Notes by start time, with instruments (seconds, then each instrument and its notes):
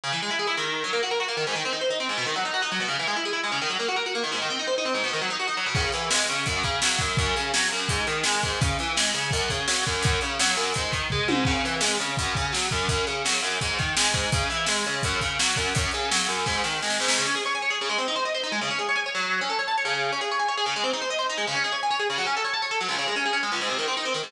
0.03 overdriven guitar C#3
0.12 overdriven guitar E3
0.22 overdriven guitar G#3
0.30 overdriven guitar E4
0.39 overdriven guitar G#4
0.47 overdriven guitar E4
0.57 overdriven guitar D#3
0.84 overdriven guitar F#3
0.93 overdriven guitar A#3
1.03 overdriven guitar F#4
1.11 overdriven guitar A#4
1.20 overdriven guitar F#4
1.28 overdriven guitar A#3
1.37 overdriven guitar D#3
1.47 overdriven guitar G#2
1.55 overdriven guitar D#3
1.65 overdriven guitar C4
1.73 overdriven guitar D#4
1.81 overdriven guitar C5
1.90 overdriven guitar D#4
2.00 overdriven guitar C4
2.09 overdriven guitar G#2
2.17 overdriven guitar B2
2.26 overdriven guitar D#3
2.36 overdriven guitar F#3
2.45 overdriven guitar D#4
2.53 overdriven guitar F#4
2.62 overdriven guitar D#4
2.72 overdriven guitar F#3
2.80 overdriven guitar B2
2.88 overdriven guitar C#3
2.99 overdriven guitar E3
3.07 overdriven guitar G#3
3.16 overdriven guitar E4
3.25 overdriven guitar G#4
3.33 overdriven guitar E4
3.44 overdriven guitar G#3
3.52 overdriven guitar C#3
3.61 overdriven guitar D#3
3.69 overdriven guitar F#3
3.79 overdriven guitar A#3
3.88 overdriven guitar F#4
3.96 overdriven guitar A#4
4.06 overdriven guitar F#4
4.15 overdriven guitar A#3
4.23 overdriven guitar D#3
4.32 overdriven guitar G#2
4.42 overdriven guitar D#3
4.50 overdriven guitar C4
4.59 overdriven guitar D#4
4.67 overdriven guitar C5
4.78 overdriven guitar D#4
4.85 overdriven guitar C4
4.94 overdriven guitar G#2
5.04 overdriven guitar B2
5.13 overdriven guitar D#3
5.21 overdriven guitar F#3
5.30 overdriven guitar D#4
5.39 overdriven guitar F#4
5.47 overdriven guitar D#4
5.57 overdriven guitar F#3
5.66 overdriven guitar B2
5.75 overdriven guitar C#3, kick, crash
5.92 overdriven guitar E3, closed hi-hat
6.10 overdriven guitar G#3, snare
6.27 overdriven guitar C#3, closed hi-hat
6.46 overdriven guitar F#2, kick, closed hi-hat
6.63 overdriven guitar C#3, kick, closed hi-hat
6.82 overdriven guitar F#3, snare
6.99 overdriven guitar F#2, kick, closed hi-hat
7.17 overdriven guitar F#2, kick, closed hi-hat
7.36 overdriven guitar C#3, closed hi-hat
7.54 overdriven guitar F#3, snare
7.71 overdriven guitar F#2, closed hi-hat
7.89 overdriven guitar G#2, kick, closed hi-hat
8.07 overdriven guitar D#3, closed hi-hat
8.24 overdriven guitar G#3, snare
8.42 overdriven guitar G#2, kick, closed hi-hat
8.61 overdriven guitar C#3, kick, closed hi-hat
8.79 overdriven guitar E3, closed hi-hat
8.96 overdriven guitar G#3, snare
9.14 overdriven guitar C#3, closed hi-hat
9.31 overdriven guitar F#2, kick, closed hi-hat
9.49 overdriven guitar C#3, kick, closed hi-hat
9.68 overdriven guitar F#3, snare
9.86 overdriven guitar F#2, kick, closed hi-hat
10.03 overdriven guitar F#2, kick, closed hi-hat
10.21 overdriven guitar C#3, closed hi-hat
10.40 overdriven guitar F#3, snare
10.56 overdriven guitar F#2, snare
10.74 overdriven guitar G#2, kick, closed hi-hat
10.92 overdriven guitar D#3, kick, closed hi-hat
11.10 overdriven guitar G#3, kick, floor tom
11.28 overdriven guitar G#2, high tom
11.45 overdriven guitar C#3, kick, crash
11.65 overdriven guitar E3, closed hi-hat
11.81 overdriven guitar G#3, snare
12.00 overdriven guitar C#3, closed hi-hat
12.17 overdriven guitar F#2, kick, closed hi-hat
12.35 overdriven guitar C#3, kick, closed hi-hat
12.52 overdriven guitar F#3, snare
12.71 overdriven guitar F#2, kick, closed hi-hat
12.89 overdriven guitar F#2, kick, closed hi-hat
13.07 overdriven guitar C#3, closed hi-hat
13.25 overdriven guitar F#3, snare
13.42 overdriven guitar F#2, closed hi-hat
13.61 overdriven guitar G#2, kick, closed hi-hat
13.79 overdriven guitar D#3, kick, closed hi-hat
13.97 overdriven guitar G#3, snare
14.13 overdriven guitar G#2, kick, closed hi-hat
14.32 overdriven guitar C#3, kick, closed hi-hat
14.50 overdriven guitar E3, closed hi-hat
14.66 overdriven guitar G#3, snare
14.84 overdriven guitar C#3, closed hi-hat
15.03 overdriven guitar F#2, kick, closed hi-hat
15.21 overdriven guitar C#3, kick, closed hi-hat
15.39 overdriven guitar F#3, snare
15.56 overdriven guitar F#2, kick, closed hi-hat
15.75 overdriven guitar F#2, kick, closed hi-hat
15.91 overdriven guitar C#3, closed hi-hat
16.11 overdriven guitar F#3, snare
16.28 overdriven guitar F#2, closed hi-hat
16.46 overdriven guitar G#2, kick, snare
16.64 overdriven guitar D#3, snare
16.82 overdriven guitar G#3, snare
16.90 snare
17.00 overdriven guitar G#2, snare
17.08 snare
17.18 overdriven guitar C#3
17.27 overdriven guitar C#4
17.35 overdriven guitar G#4
17.45 overdriven guitar C#5
17.55 overdriven guitar G#5
17.62 overdriven guitar C#5
17.70 overdriven guitar G#4
17.81 overdriven guitar C#3
17.89 overdriven guitar G#3
17.98 overdriven guitar C4
18.08 overdriven guitar D#4
18.16 overdriven guitar C5
18.25 overdriven guitar D#5
18.34 overdriven guitar C5
18.43 overdriven guitar D#4
18.52 overdriven guitar G#3
18.61 overdriven guitar C#3
18.70 overdriven guitar C#4
18.79 overdriven guitar G#4
18.89 overdriven guitar C#5
18.96 overdriven guitar G#5
19.06 overdriven guitar C#5
19.15 overdriven guitar F#3
19.41 overdriven guitar C#4
19.49 overdriven guitar A4
19.59 overdriven guitar C#5
19.68 overdriven guitar A5
19.78 overdriven guitar C#5
19.85 overdriven guitar C#3
20.12 overdriven guitar C#4
20.21 overdriven guitar G#4
20.31 overdriven guitar C#5
20.39 overdriven guitar G#5
20.48 overdriven guitar C#5
20.57 overdriven guitar G#4
20.66 overdriven guitar C#3
20.76 overdriven guitar G#3
20.84 overdriven guitar C4
20.93 overdriven guitar D#4
21.02 overdriven guitar C5
21.10 overdriven guitar D#5
21.19 overdriven guitar C5
21.29 overdriven guitar D#4
21.38 overdriven guitar G#3
21.47 overdriven guitar C#3
21.55 overdriven guitar C#4
21.64 overdriven guitar G#4
21.72 overdriven guitar C#5
21.83 overdriven guitar G#5
21.90 overdriven guitar C#5
21.99 overdriven guitar G#4
22.10 overdriven guitar C#3
22.18 overdriven guitar F#3
22.26 overdriven guitar C#4
22.36 overdriven guitar A4
22.44 overdriven guitar C#5
22.53 overdriven guitar A5
22.62 overdriven guitar C#5
22.71 overdriven guitar A4
22.81 overdriven guitar F#3
22.88 overdriven guitar C#2
22.98 overdriven guitar C#3
23.08 overdriven guitar G#3
23.16 overdriven guitar C#4
23.25 overdriven guitar G#4
23.33 overdriven guitar C#4
23.43 overdriven guitar G#3
23.52 overdriven guitar C#2
23.61 overdriven guitar G#2
23.69 overdriven guitar C3
23.78 overdriven guitar D#3
23.88 overdriven guitar C4
23.97 overdriven guitar D#4
24.05 overdriven guitar C4
24.14 overdriven guitar D#3
24.23 overdriven guitar G#2